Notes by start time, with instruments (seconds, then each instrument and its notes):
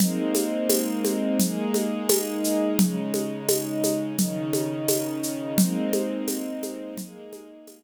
0.00 string ensemble 1 G#3 A#3 C4 D#4, low conga, shaker
0.35 high conga, shaker
0.69 tambourine, high conga, shaker
1.05 high conga, shaker
1.40 string ensemble 1 G#3 A#3 D#4 G#4, low conga, shaker
1.74 high conga, shaker
2.09 tambourine, high conga, shaker
2.44 shaker
2.78 string ensemble 1 C#3 G#3 D#4, low conga, shaker
3.14 high conga, shaker
3.49 tambourine, high conga, shaker
3.84 high conga, shaker
4.18 string ensemble 1 C#3 D#3 D#4, low conga, shaker
4.53 high conga, shaker
4.88 tambourine, high conga, shaker
5.23 shaker
5.58 string ensemble 1 G#3 A#3 C4 D#4, low conga, shaker
5.93 high conga, shaker
6.28 tambourine, high conga, shaker
6.63 high conga, shaker
6.97 string ensemble 1 G#3 A#3 D#4 G#4, low conga, shaker
7.33 high conga, shaker
7.67 tambourine, high conga, shaker